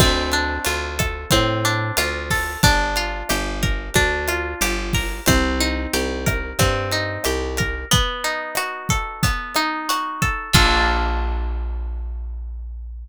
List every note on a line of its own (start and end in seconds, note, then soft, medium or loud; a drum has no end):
0.00 0.59 D2 medium
0.00 1.31 C4 medium
0.00 kick medium
0.00 cross-stick medium
0.00 crash medium
0.32 1.64 D4 medium
0.32 closed hi-hat medium
0.65 1.26 D2 medium
0.65 1.97 F4 medium
0.65 closed hi-hat medium
0.99 2.30 A4 medium
0.99 kick medium
0.99 cross-stick medium
0.99 closed hi-hat medium
1.31 1.92 A2 medium
1.31 2.57 C4 medium
1.31 kick medium
1.31 closed hi-hat medium
1.65 2.59 D4 medium
1.65 closed hi-hat medium
1.97 2.57 D2 medium
1.97 2.60 F4 medium
1.97 cross-stick medium
1.97 closed hi-hat loud
2.30 2.62 A4 medium
2.30 kick medium
2.30 open hi-hat medium
2.63 3.23 G1 medium
2.63 3.95 D4 medium
2.63 kick medium
2.63 closed hi-hat medium
2.96 4.28 F4 medium
2.96 closed hi-hat medium
3.29 3.90 G1 medium
3.29 4.61 G4 medium
3.29 cross-stick medium
3.29 closed hi-hat medium
3.63 4.94 A#4 medium
3.63 kick medium
3.63 closed hi-hat medium
3.94 4.55 D2 medium
3.94 5.21 D4 medium
3.94 kick medium
3.94 closed hi-hat medium
4.28 5.23 F4 medium
4.28 cross-stick medium
4.28 closed hi-hat medium
4.61 5.20 G1 medium
4.61 5.24 G4 medium
4.61 closed hi-hat loud
4.93 5.26 A#4 medium
4.93 kick medium
4.93 open hi-hat medium
5.26 5.87 C2 medium
5.26 6.59 C4 medium
5.26 kick medium
5.26 cross-stick medium
5.26 closed hi-hat medium
5.60 6.92 D#4 medium
5.60 closed hi-hat medium
5.93 6.53 C2 medium
5.93 7.25 G4 medium
5.93 closed hi-hat medium
6.26 7.58 A#4 medium
6.26 kick medium
6.26 cross-stick medium
6.26 closed hi-hat medium
6.59 7.18 G2 medium
6.59 7.85 C4 medium
6.59 kick medium
6.59 closed hi-hat medium
6.91 7.86 D#4 medium
6.91 closed hi-hat medium
7.24 7.85 C2 medium
7.24 7.88 G4 medium
7.24 cross-stick medium
7.24 closed hi-hat medium
7.57 7.90 A#4 medium
7.57 kick medium
7.57 closed hi-hat medium
7.91 9.23 B3 medium
7.91 kick medium
7.91 closed hi-hat medium
8.24 9.56 D#4 medium
8.24 closed hi-hat medium
8.55 9.88 F#4 medium
8.55 cross-stick medium
8.55 closed hi-hat medium
8.89 10.21 A4 medium
8.89 kick medium
8.89 closed hi-hat medium
9.23 10.48 B3 medium
9.23 kick medium
9.23 closed hi-hat medium
9.55 10.50 D#4 medium
9.55 cross-stick medium
9.55 closed hi-hat medium
9.89 10.52 F#4 medium
9.89 closed hi-hat medium
10.22 10.53 A4 medium
10.22 kick medium
10.22 closed hi-hat medium
10.53 13.08 A#1 loud
10.53 13.08 A#3 loud
10.53 13.08 D4 loud
10.53 13.08 F4 medium
10.53 13.08 A4 loud
10.53 kick loud
10.53 crash loud